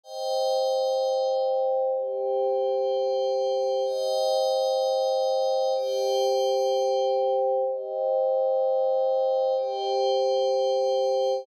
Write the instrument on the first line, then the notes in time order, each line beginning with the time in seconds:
pad 5 (bowed)
0.04 C5 D#5 G5
1.94 G4 C5 G5
3.85 C5 D#5 G5
5.75 G4 C5 G5
7.65 C5 D#5 G5
9.57 G4 C5 G5